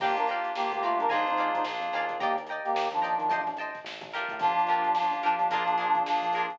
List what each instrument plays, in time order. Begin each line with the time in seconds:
0.00 synth bass 1 G1, brass section A#3 G4, electric piano 2 A#3 D4 F4 G4, acoustic guitar (steel) D5 F5 G5 A#5, kick, crash
0.17 synth bass 1 G1, brass section D4 A#4, closed hi-hat
0.27 acoustic guitar (steel) F5 G5 A#5, snare, closed hi-hat
0.32 acoustic guitar (steel) D5
0.44 closed hi-hat
0.55 synth bass 1 G1, electric piano 2 A#3 D4 F4 G4, brass section A#3 G4, snare
0.71 synth bass 1 D2, brass section A#3 G4, closed hi-hat
0.82 brass section A3 F4, acoustic guitar (steel) D5 F5 G5 A#5, closed hi-hat
0.98 synth bass 1 G2, brass section D4 A#4, closed hi-hat
1.09 synth bass 1 A#1, electric piano 2 A#3 D4 F4 G#4, brass section D#4 C5, acoustic guitar (steel) D5 F5 G#5 A#5, kick, closed hi-hat
1.26 synth bass 1 F2, brass section D#4 C5, closed hi-hat
1.37 acoustic guitar (steel) D5 F5 G#5 A#5, closed hi-hat
1.54 brass section D#4 C5, kick, closed hi-hat
1.64 synth bass 1 A#1, electric piano 2 A#3 D4 F4 G#4, snare
1.80 synth bass 1 F2, closed hi-hat
1.93 synth bass 1 D#2, acoustic guitar (steel) D5 F5 G#5 A#5, snare, closed hi-hat
2.09 kick, closed hi-hat
2.20 brass section A#3 G4, acoustic guitar (steel) D5 D#5 G5 A#5, kick, closed hi-hat
2.36 synth bass 1 D#2, closed hi-hat
2.47 acoustic guitar (steel) G5 A#5, closed hi-hat
2.51 acoustic guitar (steel) D5 D#5
2.64 brass section A#3 G4, closed hi-hat
2.74 synth bass 1 D#2, snare
2.91 synth bass 1 D#2, brass section F3 D4, closed hi-hat
3.02 acoustic guitar (steel) D5 D#5 G5 A#5, closed hi-hat
3.18 synth bass 1 D#3, closed hi-hat
3.29 synth bass 1 A1, acoustic guitar (steel) C5 D#5 G5 A5, kick, closed hi-hat
3.47 synth bass 1 A1, snare, closed hi-hat
3.57 acoustic guitar (steel) D#5 G5 A5, snare, closed hi-hat
3.61 acoustic guitar (steel) C5
3.75 kick, snare, closed hi-hat
3.84 synth bass 1 A1, snare
4.01 synth bass 1 A1, kick, snare, closed hi-hat
4.11 acoustic guitar (steel) F4 G4 A#4, snare, closed hi-hat
4.16 acoustic guitar (steel) D4
4.28 synth bass 1 A2, kick, closed hi-hat
4.39 synth bass 1 G1, brass section F3 D4, electric piano 2 A#3 D4 F4 G4, kick, closed hi-hat
4.57 synth bass 1 G1, closed hi-hat
4.67 acoustic guitar (steel) F4 G4 A#4, snare, closed hi-hat
4.71 acoustic guitar (steel) D4
4.84 closed hi-hat
4.94 synth bass 1 G1, electric piano 2 A#3 D4 F4 G4, snare
5.11 synth bass 1 G1, closed hi-hat
5.23 brass section F3 D4, acoustic guitar (steel) D4 F4 G4 A#4, closed hi-hat
5.39 synth bass 1 G1, snare, closed hi-hat
5.50 synth bass 1 A#1, electric piano 2 A#3 D4 F4 G#4, acoustic guitar (steel) F4 G#4 A#4, kick, closed hi-hat
5.54 acoustic guitar (steel) D4
5.66 synth bass 1 A#1, closed hi-hat
5.78 acoustic guitar (steel) D4 F4 G#4 A#4, snare, closed hi-hat
5.95 kick, closed hi-hat
6.05 synth bass 1 A#1, brass section F3 D4, electric piano 2 A#3 D4 F4 G#4, snare
6.21 synth bass 1 A#1, closed hi-hat
6.32 acoustic guitar (steel) G#4 A#4, snare, closed hi-hat
6.37 acoustic guitar (steel) D4 F4
6.50 synth bass 1 A#2, kick, closed hi-hat